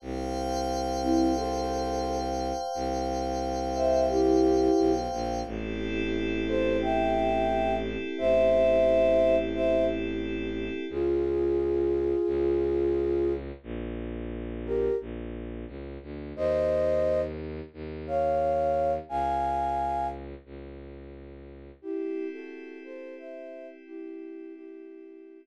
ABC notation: X:1
M:4/4
L:1/16
Q:1/4=88
K:Clyd
V:1 name="Flute"
z6 [CE]2 [Ac]6 z2 | z6 [ce]2 [EG]6 z2 | z6 [Ac]2 [eg]6 z2 | [ce]8 [ce]2 z6 |
[K:Dblyd] [FA]16 | z6 [GB]2 z8 | [ce]6 z4 [df]6 | [fa]6 z10 |
[K:Clyd] [EG]3 [FA]3 [Ac]2 [ce]3 z [EG]4 | [EG]6 z10 |]
V:2 name="Violin" clef=bass
C,,16 | C,,12 B,,,2 ^A,,,2 | A,,,16 | A,,,16 |
[K:Dblyd] D,,8 D,,8 | B,,,8 B,,,4 D,,2 =D,,2 | E,,8 E,,8 | D,,8 D,,8 |
[K:Clyd] z16 | z16 |]
V:3 name="Pad 5 (bowed)"
[c=fg]16- | [c=fg]16 | [CEGA]16- | [CEGA]16 |
[K:Dblyd] z16 | z16 | z16 | z16 |
[K:Clyd] [CEG]16- | [CEG]16 |]